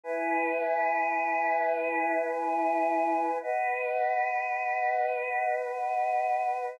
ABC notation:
X:1
M:4/4
L:1/8
Q:1/4=142
K:B
V:1 name="Choir Aahs"
[EBg]8- | [EBg]8 | [Bdf]8- | [Bdf]8 |]